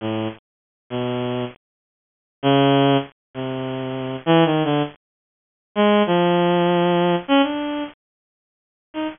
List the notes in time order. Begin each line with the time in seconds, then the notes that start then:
0.01 A2
0.90 B2
2.43 C#3
3.34 C3
4.26 E3
4.45 D#3
4.64 D3
5.75 G#3
6.06 F3
7.28 C#4
7.43 D4
8.94 D#4